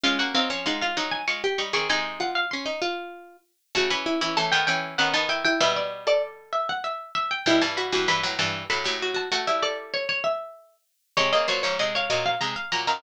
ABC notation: X:1
M:3/4
L:1/16
Q:1/4=97
K:Db
V:1 name="Harpsichord"
f g f2 g f2 a d'2 d' d' | a2 g f c'6 z2 | [K:D] a b3 a g g2 f a g g | e d2 d z2 e f e2 e g |
g a b2 b z a2 b3 a | f e d z c c e4 z2 | [K:Db] d e d2 e d2 f b2 b b |]
V:2 name="Harpsichord"
D2 C D E F E z2 =G z A | E2 F2 D E F4 z2 | [K:D] F z E E A,4 C ^D E E | B2 z A7 z2 |
E z F F B4 A G F F | A2 A8 z2 | [K:Db] d2 c d e f e z2 f z f |]
V:3 name="Harpsichord"
[A,F] [B,G] [G,E] [F,D] [A,F]2 [G,E]2 [A,F] z [=G,E] [E,C] | [C,A,]10 z2 | [K:D] [C,A,] [E,C]2 [E,C] [E,C] [^D,B,] [E,C]2 [D,B,] [D,B,]3 | [B,,G,]8 z4 |
[B,,G,] [G,,E,]2 [G,,E,] [G,,E,] [A,,F,] [G,,E,]2 [A,,F,] [A,,F,]3 | [A,F] [G,E]9 z2 | [K:Db] [C,A,] [D,B,] [B,,G,] [A,,F,] [C,A,]2 [B,,G,]2 [C,A,] z [B,,G,] [G,,E,] |]